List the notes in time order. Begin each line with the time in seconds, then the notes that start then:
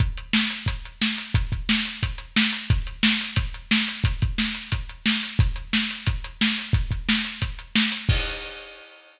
0.00 kick, closed hi-hat
0.17 closed hi-hat
0.33 snare
0.50 closed hi-hat
0.66 kick, closed hi-hat
0.85 closed hi-hat
1.02 snare
1.18 closed hi-hat
1.34 kick, closed hi-hat
1.52 kick, closed hi-hat
1.69 snare
1.85 closed hi-hat
2.03 kick, closed hi-hat
2.18 closed hi-hat
2.36 snare
2.53 closed hi-hat
2.70 kick, closed hi-hat
2.87 closed hi-hat
3.03 snare
3.21 closed hi-hat
3.36 kick, closed hi-hat
3.54 closed hi-hat
3.71 snare
3.88 closed hi-hat
4.04 kick, closed hi-hat
4.22 kick, closed hi-hat
4.38 snare
4.55 closed hi-hat
4.72 kick, closed hi-hat
4.89 closed hi-hat
5.06 snare
5.23 closed hi-hat
5.39 kick, closed hi-hat
5.56 closed hi-hat
5.73 snare
5.90 closed hi-hat
6.06 kick, closed hi-hat
6.24 closed hi-hat
6.41 snare
6.58 closed hi-hat
6.73 kick, closed hi-hat
6.91 kick, closed hi-hat
7.09 snare
7.24 closed hi-hat
7.42 kick, closed hi-hat
7.59 closed hi-hat
7.75 snare
7.92 closed hi-hat
8.09 kick, crash